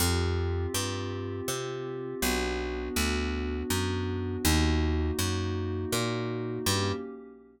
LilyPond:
<<
  \new Staff \with { instrumentName = "Pad 5 (bowed)" } { \time 3/4 \key ees \dorian \tempo 4 = 81 <c' f' g'>2. | <b d' fis'>2. | <bes ees' ges'>2. | <bes des' g'>4 r2 | }
  \new Staff \with { instrumentName = "Electric Bass (finger)" } { \clef bass \time 3/4 \key ees \dorian f,4 g,4 c4 | b,,4 d,4 fis,4 | ees,4 ges,4 bes,4 | g,4 r2 | }
>>